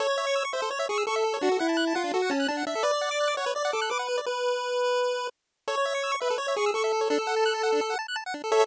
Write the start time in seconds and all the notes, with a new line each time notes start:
0.00 A4 C#5
0.08 C#5
0.18 E5
0.27 C#6
0.36 E6
0.45 C#6
0.53 C5 E5
0.62 A4
0.71 C#5
0.79 E5
0.89 G#4 C#6
0.98 E6
1.07 A4 C#6
1.16 E5
1.25 A4
1.34 C#5
1.41 D4 F#4
1.52 A4
1.59 E4 F#5
1.69 A5
1.77 F#6
1.87 A5
1.95 F4 F#5
2.04 D4
2.14 F#4 A4
2.22 F#5
2.30 C#4 A5
2.40 F#6
2.48 D4 A5
2.57 F#5
2.67 D4 E5
2.75 A4
2.83 B4 D5
2.93 D5
3.01 F#5
3.11 D6
3.20 F#6
3.28 D6
3.37 C#5 F#5
3.46 B4
3.55 D5
3.65 F#5
3.73 A4 D6
3.82 F#6
3.90 B4 D6
3.99 F#5
4.09 B4
4.18 D5
4.26 B4
5.68 A4 C#5
5.77 C#5
5.85 E5
5.95 C#6
6.03 E6
6.12 C#6
6.20 B4 E5
6.30 A4
6.38 C#5
6.48 E5
6.56 G#4 C#6
6.66 E6
6.74 A4 C#6
6.84 E5
6.93 A4
7.01 C#5
7.10 D4 A4
7.19 A4
7.27 F#5
7.36 A5
7.46 F#6
7.54 A5
7.63 F#5
7.72 D4
7.81 A4
7.90 F#5
7.99 A5
8.08 F#6
8.16 A5
8.26 F#5
8.34 D4
8.44 A4
8.52 A4 C#5 E5